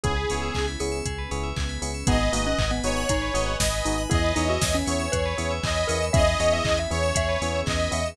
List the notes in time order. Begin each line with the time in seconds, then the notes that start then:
0.03 C#2 B3 C#4 E4 G#4, kick, closed hi-hat
0.16 B4
0.29 C#2 B3 C#4 E4 G#4 C#5, open hi-hat
0.42 E5
0.55 C#2 G#5, kick, clap
0.68 B5
0.80 C#2 B3 C#4 E4 G#4 C#6, open hi-hat
0.92 E6
1.06 C#2 B3 C#4 G#4 B4, kick, closed hi-hat
1.18 B4
1.31 C#2 B3 C#4 E4 G#4 C#5, open hi-hat
1.43 E5
1.56 C#2 G#5, kick, clap
1.69 B5
1.82 C#2 B3 C#4 E4 G#4 C#6, open hi-hat
1.94 E6
2.07 G#1 B3 D#4 F#4 G#4 B4 D#5 F#5 G#5, kick, closed hi-hat
2.21 B4
2.33 G#1 A#3 B3 D#4 F#4 G#4 D#5, open hi-hat
2.47 C#4 F#5
2.58 G#1 G#5, kick, clap
2.71 B3 B5
2.84 G#1 B3 D#4 F#4 G#4 C#5 D#6, open hi-hat
2.97 F#6
3.09 G#1 D#4 G#4 B4 D#5 G#5 B5, kick, closed hi-hat
3.22 B4
3.34 G#1 B3 D#4 F#4 G#4 D#5, open hi-hat
3.46 F#5
3.59 G#1 D#5 G#5, kick, snare
3.74 B5
3.85 G#1 B3 D#4 F#4 G#4 D#6, open hi-hat
3.98 F#6
4.10 E2 B3 C#4 E4 G#4 B4 C#5 D#5 E5 G#5, kick, closed hi-hat
4.24 B4
4.36 E2 B3 C#4 D#4 E4 G#4 C#5, open hi-hat
4.49 F#4 E5
4.62 E2 G#5, kick, snare
4.73 C#4 B5
4.86 E2 B3 C#4 E4 G#4 C#5 C#6, open hi-hat
4.99 E6
5.12 E2 G#4 B4 C#5 G#5 B5, kick, closed hi-hat
5.26 B4
5.38 E2 B3 C#4 E4 G#4 C#5, open hi-hat
5.51 E5
5.63 E2 D#5 G#5, kick, clap
5.75 B5
5.88 E2 B3 C#4 E4 G#4 A#4 C#6, open hi-hat
6.02 E6
6.13 E2 B3 C#4 E4 G#4 D#5 E5, kick, closed hi-hat
6.26 B4
6.40 E2 B3 C#4 E4 G#4 C#5 D#5, open hi-hat
6.52 E5
6.65 E2 G#5, kick, clap
6.77 E5 B5
6.91 E2 B3 C#4 E4 G#4 C#5 C#6, open hi-hat
7.03 E6
7.14 E2 B3 C#4 G#4 B4 E5, kick, closed hi-hat
7.29 B4
7.41 E2 B3 C#4 E4 G#4 C#5, open hi-hat
7.55 E5
7.66 E2 D#5 G#5, kick, clap
7.79 B5
7.91 E2 B3 C#4 E4 G#4 E5 C#6, open hi-hat
8.06 E6